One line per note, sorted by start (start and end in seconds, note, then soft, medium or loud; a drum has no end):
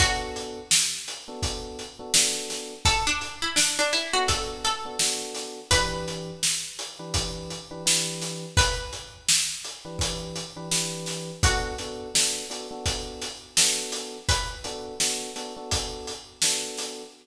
0.00 0.59 B3 loud
0.00 0.59 D4 medium
0.00 0.59 F#4 loud
0.00 2.51 F#4 loud
0.00 0.59 A4 loud
0.00 kick loud
0.00 closed hi-hat loud
0.36 closed hi-hat medium
0.71 snare loud
1.08 closed hi-hat medium
1.28 1.83 B3 loud
1.28 1.83 D4 medium
1.28 1.83 F#4 medium
1.28 1.83 A4 medium
1.43 kick loud
1.43 closed hi-hat loud
1.79 closed hi-hat medium
1.99 2.11 B3 medium
1.99 2.11 D4 medium
1.99 2.11 F#4 medium
1.99 2.11 A4 medium
2.14 2.74 B3 medium
2.14 2.74 D4 loud
2.14 2.74 F#4 medium
2.14 2.74 A4 medium
2.14 snare loud
2.50 snare medium
2.50 closed hi-hat medium
2.85 3.05 A4 loud
2.85 kick loud
2.85 closed hi-hat loud
3.07 3.35 D4 loud
3.21 closed hi-hat medium
3.42 3.56 E4 loud
3.56 3.76 D4 loud
3.56 snare loud
3.79 3.93 D4 loud
3.93 4.13 E4 loud
3.93 closed hi-hat medium
4.13 4.68 B3 medium
4.13 4.68 D4 medium
4.13 4.28 F#4 loud
4.13 4.68 F#4 medium
4.13 4.68 A4 medium
4.28 4.61 A4 loud
4.28 kick loud
4.28 closed hi-hat loud
4.64 5.28 A4 loud
4.64 closed hi-hat medium
4.85 4.97 B3 medium
4.85 4.97 D4 medium
4.85 4.97 F#4 medium
4.85 4.97 A4 medium
4.99 5.60 B3 medium
4.99 5.60 D4 medium
4.99 5.60 F#4 loud
4.99 5.60 A4 medium
4.99 snare loud
5.35 snare medium
5.35 closed hi-hat medium
5.71 6.31 E3 medium
5.71 6.31 D4 loud
5.71 6.31 G4 loud
5.71 8.36 B4 loud
5.71 6.31 B4 medium
5.71 kick loud
5.71 closed hi-hat loud
6.08 closed hi-hat medium
6.43 snare loud
6.79 closed hi-hat medium
6.99 7.54 E3 medium
6.99 7.54 D4 medium
6.99 7.54 G4 medium
6.99 7.54 B4 medium
7.14 kick loud
7.14 closed hi-hat loud
7.50 closed hi-hat medium
7.71 7.83 E3 medium
7.71 7.83 D4 medium
7.71 7.83 G4 medium
7.71 7.83 B4 medium
7.86 8.45 E3 medium
7.86 8.45 D4 medium
7.86 8.45 G4 medium
7.86 8.45 B4 medium
7.86 snare loud
8.22 snare medium
8.22 closed hi-hat medium
8.57 9.92 B4 loud
8.57 kick loud
8.57 closed hi-hat loud
8.93 closed hi-hat medium
9.29 snare loud
9.64 closed hi-hat medium
9.85 10.40 E3 medium
9.85 10.40 D4 medium
9.85 10.40 G4 medium
9.85 10.40 B4 medium
9.99 kick loud
9.99 closed hi-hat loud
10.36 closed hi-hat medium
10.56 10.68 E3 medium
10.56 10.68 D4 medium
10.56 10.68 G4 medium
10.56 10.68 B4 medium
10.71 11.31 E3 medium
10.71 11.31 D4 medium
10.71 11.31 G4 medium
10.71 11.31 B4 medium
10.71 snare loud
11.06 snare medium
11.06 closed hi-hat medium
11.43 11.72 B3 loud
11.43 11.72 D4 loud
11.43 11.72 F#4 loud
11.43 14.05 F#4 loud
11.43 11.72 A4 loud
11.43 kick loud
11.43 closed hi-hat loud
11.78 12.08 B3 loud
11.78 12.08 D4 medium
11.78 12.08 F#4 loud
11.78 12.08 A4 medium
11.78 closed hi-hat medium
12.14 12.44 B3 medium
12.14 12.44 D4 medium
12.14 12.44 F#4 medium
12.14 12.44 A4 medium
12.14 snare loud
12.50 12.66 B3 medium
12.50 12.66 D4 medium
12.50 12.66 F#4 medium
12.50 12.66 A4 medium
12.50 closed hi-hat medium
12.71 13.26 B3 medium
12.71 13.26 D4 medium
12.71 13.26 F#4 medium
12.71 13.26 A4 medium
12.86 kick loud
12.86 closed hi-hat loud
13.22 snare soft
13.22 closed hi-hat medium
13.57 14.17 B3 medium
13.57 14.17 D4 medium
13.57 14.17 F#4 medium
13.57 14.17 A4 medium
13.57 snare loud
13.92 snare medium
13.92 closed hi-hat medium
14.29 15.48 B4 loud
14.29 kick loud
14.29 closed hi-hat loud
14.64 14.94 B3 medium
14.64 14.94 D4 medium
14.64 14.94 F#4 medium
14.64 14.94 A4 medium
14.64 closed hi-hat medium
15.00 15.30 B3 medium
15.00 15.30 D4 medium
15.00 15.30 F#4 loud
15.00 15.30 A4 medium
15.00 snare loud
15.36 15.52 B3 medium
15.36 15.52 D4 medium
15.36 15.52 F#4 medium
15.36 15.52 A4 medium
15.36 closed hi-hat medium
15.57 16.11 B3 medium
15.57 16.11 D4 medium
15.57 16.11 F#4 medium
15.57 16.11 A4 medium
15.71 kick medium
15.71 closed hi-hat loud
16.07 closed hi-hat medium
16.42 17.02 B3 medium
16.42 17.02 D4 medium
16.42 17.02 F#4 medium
16.42 17.02 A4 medium
16.42 snare loud
16.77 snare medium
16.77 closed hi-hat medium